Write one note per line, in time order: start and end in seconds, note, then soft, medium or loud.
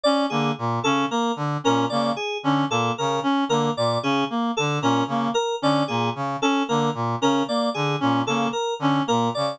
0.03 0.26 C#4 medium
0.03 0.25 D5 medium
0.30 0.52 D3 medium
0.30 0.52 A#3 medium
0.30 0.51 G#4 medium
0.58 0.79 A#2 medium
0.84 1.05 C#3 medium
0.84 1.06 C#4 medium
0.84 1.05 A4 medium
1.10 1.32 A#3 medium
1.10 1.32 A#4 medium
1.36 1.57 D3 medium
1.64 1.86 A#2 medium
1.64 1.85 C#4 medium
1.64 1.86 A#4 medium
1.89 2.12 C#3 medium
1.89 2.12 A#3 medium
1.89 2.11 D5 medium
2.16 2.38 G#4 medium
2.43 2.64 D3 medium
2.43 2.65 C#4 medium
2.70 2.91 A#2 medium
2.70 2.92 A#3 medium
2.70 2.92 A4 medium
2.98 3.20 C#3 medium
2.98 3.19 A#4 medium
3.23 3.44 C#4 medium
3.49 3.70 D3 medium
3.49 3.71 A#3 medium
3.49 3.71 A#4 medium
3.77 3.98 A#2 medium
3.77 3.98 D5 medium
4.03 4.24 C#3 medium
4.03 4.24 C#4 medium
4.03 4.24 G#4 medium
4.30 4.51 A#3 medium
4.57 4.79 D3 medium
4.57 4.78 A4 medium
4.81 5.03 A#2 medium
4.81 5.04 C#4 medium
4.81 5.04 A#4 medium
5.07 5.28 C#3 medium
5.07 5.31 A#3 medium
5.34 5.55 A#4 medium
5.62 5.83 D3 medium
5.62 5.83 C#4 medium
5.62 5.84 D5 medium
5.88 6.10 A#2 medium
5.88 6.10 A#3 medium
5.88 6.09 G#4 medium
6.15 6.36 C#3 medium
6.42 6.63 C#4 medium
6.42 6.63 A4 medium
6.68 6.90 D3 medium
6.68 6.89 A#3 medium
6.68 6.90 A#4 medium
6.94 7.15 A#2 medium
7.21 7.43 C#3 medium
7.21 7.42 C#4 medium
7.21 7.43 A#4 medium
7.48 7.69 A#3 medium
7.48 7.70 D5 medium
7.74 7.96 D3 medium
7.74 7.95 G#4 medium
8.00 8.23 A#2 medium
8.00 8.21 C#4 medium
8.26 8.47 C#3 medium
8.26 8.49 A#3 medium
8.26 8.48 A4 medium
8.53 8.74 A#4 medium
8.79 9.00 D3 medium
8.79 9.03 C#4 medium
9.07 9.30 A#2 medium
9.07 9.28 A#3 medium
9.07 9.29 A#4 medium
9.35 9.57 C#3 medium
9.35 9.56 D5 medium